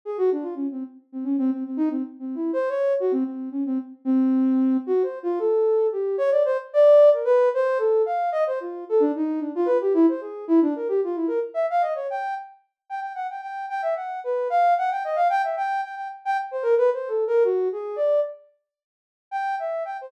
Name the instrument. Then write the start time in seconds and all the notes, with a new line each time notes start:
ocarina
0.05 G#4
0.18 F#4
0.32 D4
0.42 F4
0.55 C#4
0.71 C4
1.12 C4
1.24 C#4
1.38 C4
1.52 C4
1.66 C4
1.77 D#4
1.90 C4
2.19 C4
2.35 E4
2.53 C5
2.69 C#5
3.00 F#4
3.12 C4
3.25 C4
3.51 C#4
3.66 C4
4.05 C4
4.87 F#4
5.03 C5
5.23 F4
5.39 A4
5.92 G4
6.18 C#5
6.31 D5
6.45 C5
6.73 D5
7.13 A#4
7.25 B4
7.54 C5
7.78 A4
8.06 F5
8.32 D#5
8.47 C5
8.60 F4
8.89 A4
9.00 D4
9.16 D#4
9.40 D4
9.55 F4
9.66 B4
9.81 G4
9.94 E4
10.08 C5
10.21 G#4
10.48 E4
10.62 D4
10.76 A#4
10.88 G4
11.04 F4
11.15 E4
11.27 A#4
11.54 E5
11.70 F5
11.81 D#5
11.95 C#5
12.10 G5
12.90 G5
13.01 G5
13.15 F#5
13.30 G5
13.42 G5
13.69 G5
13.82 E5
13.96 F#5
14.24 B4
14.50 F5
14.78 F#5
14.91 G5
15.04 D#5
15.16 F5
15.30 G5
15.44 E5
15.57 G5
15.83 G5
15.96 G5
16.25 G5
16.51 C5
16.63 A#4
16.78 B4
16.93 C5
17.08 A4
17.27 A#4
17.44 F#4
17.72 G#4
17.96 D5
19.31 G5
19.59 E5
19.85 G5
20.01 C5